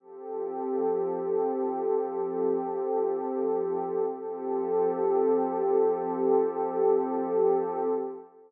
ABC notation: X:1
M:4/4
L:1/8
Q:1/4=59
K:F
V:1 name="Pad 2 (warm)"
[F,CGA]8 | [F,CGA]8 |]